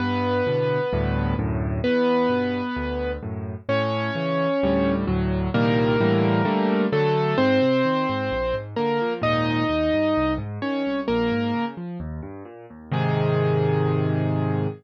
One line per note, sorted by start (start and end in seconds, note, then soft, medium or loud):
0.00 0.42 G2 loud
0.00 1.34 B3 loud
0.00 1.34 B4 loud
0.47 0.79 A2 medium
0.47 0.79 B2 medium
0.47 0.79 D3 medium
0.93 1.34 D2 loud
0.93 1.34 G2 loud
0.93 1.34 A2 loud
1.39 1.81 D2 medium
1.39 1.81 F#2 loud
1.39 1.81 A2 loud
1.84 2.27 E2 loud
1.84 3.11 B3 loud
1.84 3.11 B4 loud
2.29 2.61 G2 medium
2.29 2.61 B2 medium
2.76 3.18 D2 medium
3.22 3.55 F#2 medium
3.22 3.55 A2 medium
3.69 4.10 A2 loud
3.69 4.94 C#4 loud
3.69 4.94 C#5 loud
4.15 4.47 C#3 medium
4.15 4.47 E3 medium
4.63 5.05 D2 loud
4.63 5.05 A2 loud
4.63 5.05 G3 loud
5.07 5.49 D2 loud
5.07 5.49 A2 loud
5.07 5.49 F#3 loud
5.54 5.96 C2 loud
5.54 5.96 A#2 loud
5.54 5.96 D#3 loud
5.54 5.96 G3 loud
5.54 6.85 A#3 loud
5.54 6.85 A#4 loud
6.00 6.42 A2 loud
6.00 6.42 D3 loud
6.00 6.42 E3 loud
6.00 6.42 G3 loud
6.45 6.87 D3 loud
6.45 6.87 G3 loud
6.45 6.87 A3 loud
6.92 7.34 D3 loud
6.92 7.34 F#3 medium
6.92 7.37 A3 loud
6.92 7.37 A4 loud
7.38 7.59 G#2 loud
7.38 8.55 C4 loud
7.38 8.55 C5 loud
7.62 7.83 C3 medium
7.85 8.06 D#3 medium
8.09 8.30 G#2 medium
8.32 8.52 A#1 medium
8.54 8.74 G#2 medium
8.76 8.99 D3 medium
8.76 9.13 A#3 medium
8.76 9.13 A#4 loud
9.02 9.22 F3 medium
9.22 9.63 D#2 medium
9.22 9.63 G#2 medium
9.22 9.63 A#2 medium
9.22 10.34 D#4 loud
9.22 10.34 D#5 loud
9.69 9.90 D#2 medium
9.93 10.14 G2 medium
10.17 10.38 C2 medium
10.38 10.59 G#2 medium
10.62 10.83 D#3 medium
10.62 11.00 C#4 medium
10.62 11.00 C#5 medium
10.86 11.07 C2 medium
11.08 11.30 A#1 medium
11.08 11.65 A#3 loud
11.08 11.65 A#4 loud
11.32 11.53 G#2 medium
11.54 11.75 C#3 medium
11.77 11.98 F3 medium
12.00 12.21 D#2 medium
12.22 12.43 G2 medium
12.45 12.66 A#2 medium
12.70 12.91 D#2 medium
12.92 14.67 G#2 loud
12.92 14.67 C3 loud
12.92 14.67 D#3 loud
12.92 14.69 G#4 loud